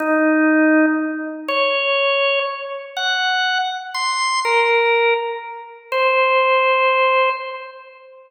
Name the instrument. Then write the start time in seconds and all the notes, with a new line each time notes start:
drawbar organ
0.00 D#4
1.48 C#5
2.97 F#5
3.94 C6
4.45 A#4
5.92 C5